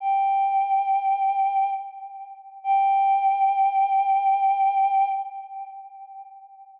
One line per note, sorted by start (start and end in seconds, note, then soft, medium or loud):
0.00 1.70 G5 medium
2.64 5.09 G5 loud